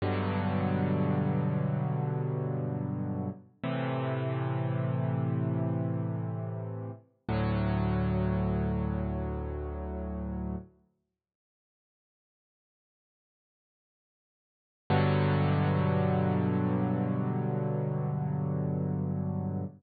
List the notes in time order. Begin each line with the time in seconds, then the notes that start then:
0.02 G2 B2 D3 F#3
3.64 A2 C3 E3
7.29 D2 A2 F#3
14.90 G2 B2 D3 F#3